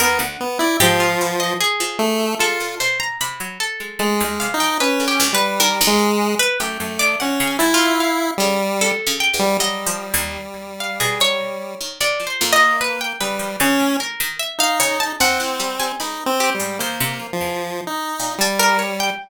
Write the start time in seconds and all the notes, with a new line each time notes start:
0.00 D#2 B3 A#4
0.19 D2 F#5
0.41 B3
0.59 E4 D5
0.80 G#2 F3 G4
1.00 F4
1.21 B2
1.40 D#5
1.61 G#4
1.80 F3
1.99 A3
2.39 G#3 F4 A4
2.60 A#2
2.80 B2 C5
3.00 A#5
3.21 C3 B5
3.40 F#3
3.60 A4
3.80 G#3
3.99 G#3 A3
4.20 D#2 G#3
4.40 C3 F5
4.54 D#4
4.60 F3 G5
4.80 C#4 B4
5.00 D3
5.08 G4
5.20 C#2
5.33 G3 B4
5.60 D#3 A#4
5.81 D#2
5.87 G#3
5.99 G#2
6.39 B4
6.60 F#2 A3 G4
6.80 F#2 A3
6.99 D#3 D5
7.20 A#2 C#4 F#5
7.40 C#3
7.47 G#5
7.59 G#2 E4
7.74 F4
7.81 D3
8.00 F5
8.38 C#3 G3
8.81 C3 A4
9.07 C#3
9.20 G5
9.34 E2
9.39 G3
9.59 F#3 G3 D#5
9.87 F3
10.14 D#2
10.80 F5
11.00 B2 G#4
11.20 F#3 C#5
11.81 D#3
12.01 C3 D5
12.20 F3
12.27 C5
12.41 F2 A#3
12.53 D#5
12.60 F3
12.81 B4
13.01 G5
13.20 C#3 G3 B4
13.39 F3
13.60 C#3 C#4
13.79 A2
14.00 A#4
14.20 D#3
14.40 E5
14.59 D#4 F5
14.80 C#3 C#5
15.00 A5
15.20 D#2 C4 F#5
15.40 A2 F#5
15.60 G3
15.80 G3 G#5
16.00 C#2 D#4 B5
16.26 C4
16.40 G4
16.55 G3
16.60 G#2
16.79 D#2 A#3 C5
17.00 C3
17.20 F3
17.33 F3
17.40 E2
17.87 D#4
18.20 A#2
18.38 G3 A5
18.59 A3 A#4
18.79 C#5
19.00 G5